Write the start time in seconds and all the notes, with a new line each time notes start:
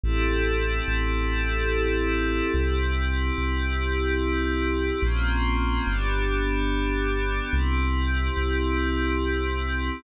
0.03 A1 C4 E4 G4 A4
0.88 A1
2.54 C2 C4 E4 G4
3.38 C2
5.02 A#1 A#3 C4 C#4 F4
5.87 G1 B3 D4 G4
7.53 C2 C4 E4 G4
8.37 C2